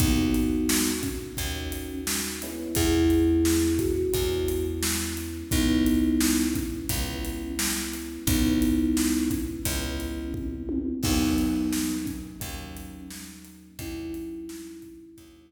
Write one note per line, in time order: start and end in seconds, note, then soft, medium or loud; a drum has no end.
0.00 1.29 D#2 medium
0.00 1.26 A#3 loud
0.00 0.91 B3 medium
0.00 1.26 C#4 loud
0.00 0.91 D#4 medium
0.00 1.26 D#4 loud
0.00 1.26 F#4 loud
0.00 kick loud
0.00 closed hi-hat loud
0.34 closed hi-hat medium
0.69 snare loud
1.03 1.93 C#4 medium
1.03 kick medium
1.03 closed hi-hat medium
1.37 2.67 D#2 medium
1.37 2.37 A#3 loud
1.37 2.37 C#4 loud
1.37 2.37 D#4 medium
1.37 2.37 F#4 medium
1.37 kick loud
1.37 closed hi-hat loud
1.72 closed hi-hat medium
2.07 snare loud
2.42 4.04 G#3 loud
2.42 4.04 B3 loud
2.42 4.04 C#4 loud
2.42 4.04 E4 loud
2.42 closed hi-hat medium
2.75 4.05 E2 medium
2.75 3.73 E4 medium
2.75 3.73 G#4 medium
2.75 kick loud
2.75 closed hi-hat loud
3.10 closed hi-hat medium
3.45 snare loud
3.79 4.66 F#4 medium
3.79 kick loud
3.79 closed hi-hat medium
4.13 5.43 E2 medium
4.13 5.40 G#3 medium
4.13 5.40 B3 medium
4.13 5.40 C#4 loud
4.13 5.40 E4 loud
4.13 kick loud
4.13 closed hi-hat loud
4.48 closed hi-hat medium
4.83 snare loud
5.17 closed hi-hat medium
5.51 6.81 C#2 medium
5.51 6.78 G#3 loud
5.51 6.78 B3 loud
5.51 6.45 B3 medium
5.51 6.78 C#4 loud
5.51 6.45 D#4 medium
5.51 6.78 E4 loud
5.51 kick loud
5.51 closed hi-hat loud
5.86 closed hi-hat medium
6.21 snare loud
6.54 7.47 C#4 medium
6.54 kick loud
6.54 closed hi-hat medium
6.89 8.19 C#2 medium
6.89 8.18 G#3 medium
6.89 8.18 B3 loud
6.89 8.18 C#4 loud
6.89 8.18 E4 medium
6.89 kick loud
6.89 closed hi-hat loud
7.25 closed hi-hat medium
7.59 snare loud
7.94 closed hi-hat medium
8.27 9.56 C#2 medium
8.27 9.55 G#3 loud
8.27 9.29 B3 medium
8.27 9.55 B3 loud
8.27 9.55 C#4 loud
8.27 9.29 D#4 medium
8.27 9.55 E4 loud
8.27 kick loud
8.27 closed hi-hat loud
8.62 closed hi-hat medium
8.97 snare loud
9.30 10.27 C#4 medium
9.30 kick loud
9.30 closed hi-hat medium
9.65 10.94 C#2 medium
9.65 10.93 G#3 medium
9.65 10.93 B3 loud
9.65 10.93 C#4 loud
9.65 10.93 E4 medium
9.65 kick loud
9.65 closed hi-hat loud
10.00 closed hi-hat medium
10.34 kick medium
10.34 high tom medium
10.69 high tom loud
11.03 12.33 D#2 medium
11.03 12.31 F#3 loud
11.03 12.31 A#3 loud
11.03 11.97 B3 medium
11.03 12.31 C#4 loud
11.03 11.97 D#4 medium
11.03 12.31 D#4 loud
11.03 kick loud
11.03 crash loud
11.38 closed hi-hat medium
11.73 snare loud
12.06 13.00 C#4 medium
12.06 kick medium
12.06 closed hi-hat medium
12.40 13.71 D#2 medium
12.40 13.67 F#3 loud
12.40 13.67 A#3 loud
12.40 13.67 C#4 loud
12.40 13.67 D#4 medium
12.40 kick loud
12.40 closed hi-hat loud
12.77 closed hi-hat medium
13.10 snare loud
13.45 closed hi-hat medium
13.79 15.08 D#2 medium
13.79 15.06 F#3 loud
13.79 15.06 A#3 loud
13.79 15.06 C#4 loud
13.79 15.52 C#4 medium
13.79 15.06 D#4 loud
13.79 15.52 E4 medium
13.79 kick loud
13.79 closed hi-hat loud
14.14 closed hi-hat loud
14.49 snare loud
14.82 kick medium
14.82 closed hi-hat medium
15.17 15.52 D#2 medium
15.17 15.52 F#3 loud
15.17 15.52 A#3 loud
15.17 15.52 C#4 loud
15.17 15.52 D#4 loud
15.17 kick loud
15.17 closed hi-hat loud